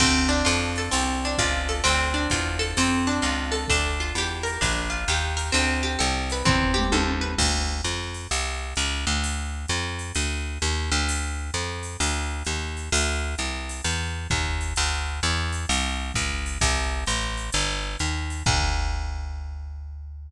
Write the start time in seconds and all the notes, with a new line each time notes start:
0.00 D2 C4, kick, crash, ride
0.29 D4
0.45 F2 F4, hi-hat pedal, ride
0.76 A4, ride
0.91 C2 C4, ride
1.25 D4
1.38 C#2 F4, kick, hi-hat pedal, ride
1.68 A4, ride
1.84 D2 C4, ride
2.14 D4
2.30 E2 F4, kick, hi-hat pedal, ride
2.59 A4, ride
2.77 F2 C4, ride
3.07 D4
3.22 C#2 F4, hi-hat pedal, ride
3.52 A4, ride
3.68 D2 D4, kick, ride
4.00 F4
4.15 E2 G4, hi-hat pedal, ride
4.43 A#4, ride
4.61 A#1 D4, kick, ride
4.90 F4
5.08 D#2 G4, hi-hat pedal, ride
5.37 A#4, ride
5.52 D2 C4, ride
5.83 G4
5.99 C2 A4, hi-hat pedal, ride
6.30 B4, ride
6.45 E2 C4, kick, floor tom
6.74 G4, mid tom
6.92 D#2 A4, high tom
7.21 B4
7.38 D2, kick, crash, ride
7.84 F2, hi-hat pedal, ride
8.14 ride
8.31 C2, ride
8.76 C#2, hi-hat pedal, ride
9.07 D2, ride
9.24 ride
9.68 F2, hi-hat pedal, ride
9.99 ride
10.15 D2, ride
10.62 D#2, hi-hat pedal, ride
10.92 D2, ride
11.09 ride
11.54 F2, hi-hat pedal, ride
11.83 ride
12.00 D2, ride
12.45 D#2, hi-hat pedal, ride
12.77 ride
12.92 D2, ride
13.38 C2, hi-hat pedal, ride
13.69 ride
13.84 E2, ride
14.30 D#2, kick, hi-hat pedal, ride
14.61 ride
14.76 D2, ride
15.23 E2, hi-hat pedal, ride
15.52 ride
15.69 C2, ride
16.14 C#2, kick, hi-hat pedal, ride
16.46 ride
16.61 C2, kick, ride
17.06 A1, hi-hat pedal, ride
17.37 ride
17.52 G1, ride
17.99 D#2, hi-hat pedal, ride
18.30 ride
18.46 D2, kick, crash